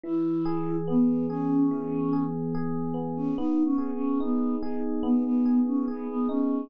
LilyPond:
<<
  \new Staff \with { instrumentName = "Choir Aahs" } { \time 4/4 \key b \major \tempo 4 = 72 e'4 b8 cis'4~ cis'16 r4 cis'16 | \tuplet 3/2 { dis'8 cis'8 cis'8 } b8 dis'16 r16 b16 b8 cis'16 b16 b16 cis'8 | }
  \new Staff \with { instrumentName = "Electric Piano 1" } { \time 4/4 \key b \major e8 gis'8 b8 gis'8 e8 gis'8 gis'8 b8 | b8 gis'8 dis'8 gis'8 b8 gis'8 gis'8 dis'8 | }
>>